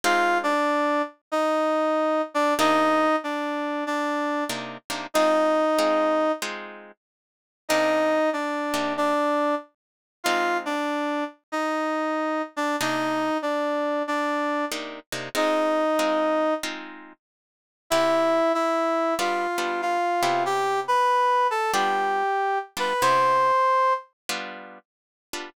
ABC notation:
X:1
M:4/4
L:1/8
Q:"Swing" 1/4=94
K:Cm
V:1 name="Brass Section"
[Ff] [Dd]2 z [Ee]3 [Dd] | [Ee]2 [Dd]2 [Dd]2 z2 | [Ee]4 z4 | [Ee]2 [Dd]2 [Dd]2 z2 |
[Ff] [Dd]2 z [Ee]3 [Dd] | [Ee]2 [Dd]2 [Dd]2 z2 | [Ee]4 z4 | [K:C] [Ee]2 [Ee]2 [Ff]2 [Ff]2 |
[Gg] [Bb]2 [Aa] [Gg]3 [Bb] | [cc']3 z5 |]
V:2 name="Acoustic Guitar (steel)"
[A,CEF]8 | [C,B,DE]6 [C,B,DE] [C,B,DE] | [A,CEF]2 [A,CEF]2 [A,CEF]4 | [C,B,DE]3 [C,B,DE]5 |
[A,CEF]8 | [C,B,DE]6 [C,B,DE] [C,B,DE] | [A,CEF]2 [A,CEF]2 [A,CEF]4 | [K:C] [C,B,EG]4 [G,B,DF] [G,B,DF]2 [C,B,EG]- |
[C,B,EG]4 [G,B,DF]3 [G,B,DF] | [C,B,EG]4 [G,B,DF]3 [G,B,DF] |]